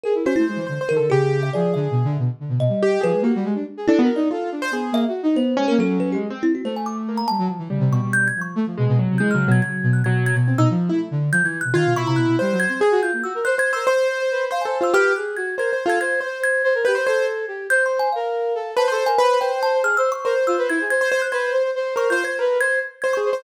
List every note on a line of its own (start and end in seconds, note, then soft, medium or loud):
0.04 0.14 G#4 medium
0.04 0.23 A#4 medium
0.15 0.24 E4 medium
0.25 0.34 C#4 medium
0.25 0.36 F#4 loud
0.25 0.65 C5 medium
0.36 0.48 A3 medium
0.36 0.45 E4 loud
0.47 0.57 G#3 medium
0.56 0.66 E3 medium
0.67 0.78 D3 medium
0.67 0.79 C5 medium
0.81 0.94 C5 medium
0.89 1.00 D#3 medium
0.89 1.08 A#4 loud
0.97 1.09 D3 medium
0.97 1.09 A4 medium
1.10 1.49 C#3 loud
1.10 1.50 G4 loud
1.10 1.39 G#4 loud
1.43 1.52 E5 medium
1.53 1.74 F3 medium
1.53 2.12 G#4 medium
1.53 1.73 D5 medium
1.74 1.88 D3 loud
1.74 2.12 E5 medium
1.91 2.03 B2 medium
2.04 2.17 D3 loud
2.18 2.28 B2 medium
2.40 2.49 D3 medium
2.49 2.58 B2 medium
2.59 2.68 B2 medium
2.59 2.98 D#5 medium
2.69 2.97 G3 medium
2.83 3.02 G4 loud
3.01 3.13 F3 loud
3.01 3.20 G#4 medium
3.01 3.23 B4 loud
3.13 3.22 G#3 medium
3.22 3.31 A#3 loud
3.22 3.43 F#4 soft
3.22 3.62 G4 medium
3.35 3.45 G3 loud
3.44 3.54 G#3 loud
3.55 3.65 D4 medium
3.77 3.86 G#4 medium
3.87 3.98 D4 loud
3.87 4.00 E4 loud
3.87 4.00 A4 loud
3.99 4.08 B3 loud
3.99 4.13 F#4 medium
4.03 4.16 A#4 medium
4.16 4.28 D#4 loud
4.16 4.29 D5 medium
4.31 4.50 F4 medium
4.31 4.50 A4 medium
4.52 4.71 D4 medium
4.62 4.72 C5 loud
4.71 4.90 B3 medium
4.71 5.02 G#4 medium
4.92 5.05 A#3 loud
4.92 5.04 E5 loud
5.08 5.21 F#4 medium
5.23 5.36 D#4 loud
5.35 5.54 B3 medium
5.35 5.65 C5 medium
5.57 5.67 G#3 medium
5.57 5.76 C#4 loud
5.68 5.79 A#3 loud
5.68 5.78 A#4 medium
5.79 5.98 F#3 medium
5.79 6.18 C#4 loud
5.79 5.99 A4 loud
5.99 6.12 F#3 medium
5.99 6.10 B4 medium
6.12 6.27 G#3 medium
6.12 6.22 G4 medium
6.30 6.43 C4 medium
6.42 6.61 C4 medium
6.42 6.52 E4 loud
6.55 6.64 F#4 medium
6.64 7.22 A3 medium
6.64 6.75 C5 medium
6.76 6.86 G#5 medium
6.86 6.96 D6 medium
7.09 7.28 A#3 medium
7.17 7.27 A#5 medium
7.28 7.39 G3 medium
7.28 7.47 A5 loud
7.39 7.48 F#3 loud
7.48 7.58 F3 medium
7.59 7.68 E3 medium
7.70 7.79 C#3 medium
7.70 8.27 G3 medium
7.80 7.89 C3 loud
7.91 8.00 B2 loud
7.91 8.12 C#6 medium
8.02 8.31 B2 medium
8.13 8.26 G6 loud
8.28 8.40 G#6 medium
8.36 8.55 F3 medium
8.41 8.54 C#6 medium
8.55 8.65 A3 loud
8.67 8.76 F3 medium
8.78 8.88 B2 medium
8.78 8.97 G#3 medium
8.88 8.98 B2 loud
8.99 9.09 B2 medium
8.99 9.18 F#3 medium
9.10 9.20 C3 medium
9.18 9.32 E3 medium
9.18 9.33 G#3 loud
9.18 9.28 G6 medium
9.31 9.46 C#3 medium
9.31 9.47 F#3 medium
9.31 9.50 F6 medium
9.47 9.60 B2 loud
9.47 9.61 F#3 loud
9.52 9.61 G#6 medium
9.62 9.81 C#3 medium
9.62 10.00 F#3 medium
9.62 9.91 G#6 medium
9.83 10.02 B2 loud
9.93 10.03 F#6 medium
10.04 10.32 B2 medium
10.04 10.35 F#3 loud
10.04 10.23 G#6 medium
10.26 10.36 G#6 loud
10.35 10.54 B2 loud
10.35 10.56 G#6 medium
10.48 10.57 C4 medium
10.58 10.67 B2 loud
10.58 10.68 D#4 loud
10.58 10.68 E6 medium
10.70 10.89 F3 loud
10.89 11.09 A3 medium
10.89 10.99 E4 medium
11.11 11.30 D3 medium
11.32 11.42 F3 loud
11.32 11.45 G6 loud
11.43 11.62 E3 medium
11.43 11.58 G#6 medium
11.61 11.74 B2 medium
11.61 11.74 F#6 medium
11.73 11.83 D#3 loud
11.73 11.93 F4 loud
11.73 11.94 G#6 medium
11.85 11.95 B2 medium
11.95 12.05 B2 medium
11.95 12.35 E4 loud
11.95 12.06 C#6 loud
12.06 12.16 C3 medium
12.06 12.17 A#5 medium
12.16 12.26 B2 medium
12.16 12.55 F#6 medium
12.27 12.37 B2 medium
12.39 12.54 G3 loud
12.39 12.77 C5 medium
12.52 12.65 F#3 loud
12.60 12.69 G#6 loud
12.69 12.81 C4 medium
12.69 12.80 G#6 medium
12.80 12.89 G#4 medium
12.80 13.00 G#4 medium
12.80 13.02 G#6 medium
12.91 13.01 F#4 loud
13.02 13.11 F4 medium
13.02 13.22 G6 medium
13.13 13.23 A#3 soft
13.23 13.33 F#4 medium
13.23 13.43 E6 medium
13.35 13.44 A#4 medium
13.45 13.58 C5 medium
13.45 13.55 C5 loud
13.45 13.57 F#6 medium
13.56 13.75 C5 medium
13.56 13.71 C5 medium
13.56 13.72 G#6 loud
13.73 13.85 A#4 medium
13.73 13.86 C5 medium
13.73 13.86 E6 medium
13.87 14.44 C5 loud
13.87 14.08 C5 loud
13.87 14.45 C6 medium
14.09 14.19 C5 medium
14.20 14.29 C5 medium
14.31 14.50 B4 medium
14.51 14.63 C5 medium
14.51 14.65 C5 soft
14.51 14.62 F5 medium
14.61 14.80 G#5 soft
14.65 14.78 A4 medium
14.65 14.78 C5 medium
14.80 14.94 F4 medium
14.80 14.92 C5 medium
14.80 14.93 E6 medium
14.93 15.13 G4 loud
14.93 15.12 B4 medium
14.93 15.13 F6 loud
15.16 15.36 G#4 medium
15.16 15.35 F#6 medium
15.36 15.55 F#4 medium
15.36 15.56 G#6 medium
15.57 15.70 A#4 medium
15.57 15.71 C5 medium
15.57 15.79 G#6 medium
15.71 15.84 C5 medium
15.71 15.86 C5 medium
15.86 15.98 F4 medium
15.86 15.99 A4 medium
15.86 15.99 G#6 medium
16.00 16.20 C5 medium
16.00 16.20 G#6 loud
16.21 16.40 C5 medium
16.21 16.62 C5 medium
16.44 16.82 G#6 loud
16.64 16.73 C5 loud
16.75 16.84 A#4 medium
16.85 16.96 G4 medium
16.85 16.94 B4 medium
16.85 17.05 G6 medium
16.95 17.05 C5 medium
17.06 17.45 A4 medium
17.06 17.26 C5 loud
17.06 17.64 G#6 medium
17.48 17.67 G4 medium
17.70 18.08 C5 loud
17.70 17.83 G6 loud
17.86 17.99 C6 medium
17.99 18.12 G#5 loud
18.12 18.54 A#4 medium
18.12 18.70 F5 medium
18.55 18.74 A4 medium
18.77 18.86 B4 loud
18.77 18.91 C5 medium
18.77 18.91 A5 medium
18.88 19.04 A4 loud
18.88 19.07 C5 loud
18.92 19.05 C6 medium
19.06 19.19 A#4 medium
19.06 19.19 G#5 loud
19.18 19.38 B4 loud
19.18 19.29 C5 medium
19.18 19.39 B5 loud
19.30 19.40 C5 medium
19.41 19.51 B4 medium
19.41 19.80 C5 medium
19.41 19.60 G5 loud
19.51 19.61 C5 medium
19.63 19.73 C5 loud
19.63 19.82 A5 loud
19.74 19.83 C5 medium
19.83 19.96 G#4 medium
19.83 19.97 F6 loud
19.97 20.10 C5 loud
19.97 20.10 E6 loud
20.12 20.25 C5 medium
20.12 20.25 C#6 loud
20.24 20.34 A#4 loud
20.24 20.82 C5 medium
20.35 20.44 C5 medium
20.47 20.57 F4 medium
20.47 20.57 E6 medium
20.58 20.68 B4 loud
20.69 20.79 E4 loud
20.69 20.89 G#6 medium
20.81 20.91 G#4 medium
20.90 21.09 C5 medium
20.90 21.19 G#6 loud
21.01 21.11 C5 loud
21.12 21.21 C5 loud
21.12 21.21 C5 medium
21.22 21.33 C5 medium
21.22 21.31 F#6 medium
21.32 21.52 B4 loud
21.32 21.71 C5 medium
21.32 21.51 G#6 medium
21.52 21.62 C5 medium
21.63 21.73 C5 medium
21.75 21.95 C5 loud
21.96 22.09 A#4 medium
21.96 22.08 C5 medium
21.96 22.10 C#6 medium
22.10 22.22 F4 medium
22.10 22.23 C5 loud
22.10 22.23 G6 medium
22.24 22.37 C5 medium
22.24 22.38 C5 medium
22.24 22.37 G#6 medium
22.39 22.58 A#4 medium
22.39 22.59 B4 loud
22.60 22.79 C5 loud
22.60 22.80 G#6 loud
23.02 23.16 C5 medium
23.02 23.11 G#6 medium
23.13 23.30 G#4 medium
23.13 23.42 C#6 medium
23.25 23.43 C5 medium
23.33 23.43 C5 medium